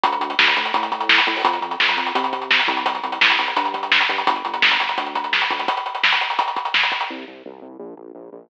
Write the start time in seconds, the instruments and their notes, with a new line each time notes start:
0.04 synth bass 1 D2, kick, closed hi-hat
0.12 closed hi-hat
0.20 synth bass 1 D2, closed hi-hat
0.30 closed hi-hat
0.39 synth bass 1 D2, snare
0.48 closed hi-hat
0.56 synth bass 1 D2, closed hi-hat
0.65 closed hi-hat
0.74 synth bass 1 A2, kick, closed hi-hat
0.83 closed hi-hat
0.92 kick, closed hi-hat
1.01 closed hi-hat
1.09 snare
1.18 closed hi-hat
1.27 synth bass 1 A2, kick, closed hi-hat
1.36 open hi-hat
1.44 synth bass 1 F2, kick, closed hi-hat
1.53 closed hi-hat
1.61 synth bass 1 F2, closed hi-hat
1.71 closed hi-hat
1.80 synth bass 1 F2, snare
1.89 closed hi-hat
1.97 synth bass 1 F2, closed hi-hat
2.07 closed hi-hat
2.15 synth bass 1 C3, kick, closed hi-hat
2.24 closed hi-hat
2.33 kick, closed hi-hat
2.42 closed hi-hat
2.51 snare
2.59 closed hi-hat
2.67 synth bass 1 C2, kick, closed hi-hat
2.77 closed hi-hat
2.86 kick, closed hi-hat
2.95 closed hi-hat
3.03 synth bass 1 C2, closed hi-hat
3.12 closed hi-hat
3.21 synth bass 1 C2, snare
3.30 closed hi-hat
3.39 synth bass 1 C2, closed hi-hat
3.48 closed hi-hat
3.56 synth bass 1 G2, kick, closed hi-hat
3.65 closed hi-hat
3.74 kick, closed hi-hat
3.83 closed hi-hat
3.92 snare
4.01 closed hi-hat
4.09 synth bass 1 G2, kick, closed hi-hat
4.18 closed hi-hat
4.27 synth bass 1 G1, kick, closed hi-hat
4.36 closed hi-hat
4.45 synth bass 1 G1, closed hi-hat
4.54 closed hi-hat
4.62 synth bass 1 G1, snare
4.71 closed hi-hat
4.80 synth bass 1 G1, closed hi-hat
4.89 closed hi-hat
4.98 synth bass 1 D2, kick, closed hi-hat
5.06 closed hi-hat
5.15 kick, closed hi-hat
5.24 closed hi-hat
5.33 snare
5.42 closed hi-hat
5.51 synth bass 1 D2, kick, closed hi-hat
5.59 closed hi-hat
5.68 kick, closed hi-hat
5.77 closed hi-hat
5.86 closed hi-hat
5.95 closed hi-hat
6.04 snare
6.12 closed hi-hat
6.21 closed hi-hat
6.30 closed hi-hat
6.39 kick, closed hi-hat
6.48 closed hi-hat
6.56 kick, closed hi-hat
6.65 closed hi-hat
6.74 snare
6.83 closed hi-hat
6.92 kick, closed hi-hat
7.01 closed hi-hat
7.10 synth bass 1 C2
7.27 synth bass 1 C2
7.46 synth bass 1 C2
7.62 synth bass 1 C2
7.79 synth bass 1 A#1
7.97 synth bass 1 A#1
8.15 synth bass 1 A#1
8.32 synth bass 1 A#1